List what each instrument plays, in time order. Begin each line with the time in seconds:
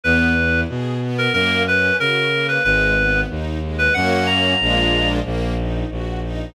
0.04 violin E2, string ensemble 1 B3, clarinet B4
0.37 string ensemble 1 E4
0.69 violin B2, string ensemble 1 G#4
1.01 string ensemble 1 B3
1.18 clarinet A#4
1.33 violin F#2, string ensemble 1 A#3, clarinet A#4
1.66 string ensemble 1 C#4, clarinet B4
1.98 violin C#3, string ensemble 1 F#4, clarinet A#4
2.33 string ensemble 1 A#3
2.48 clarinet B4
2.64 violin G#1, string ensemble 1 G#3, clarinet B4
2.97 string ensemble 1 B3
3.30 violin D#2, string ensemble 1 D#4
3.63 string ensemble 1 G#3
3.78 clarinet B4
3.94 violin F#2, string ensemble 1 A#3 C#4 F#4, clarinet F#5
4.11 clarinet F#5
4.26 clarinet A#5
4.60 violin A#1, string ensemble 1 G#3 A#3 D4 F4
5.25 violin A#1, string ensemble 1 A#3
5.58 string ensemble 1 D#4
5.91 violin A#1, string ensemble 1 F#4
6.23 string ensemble 1 D#4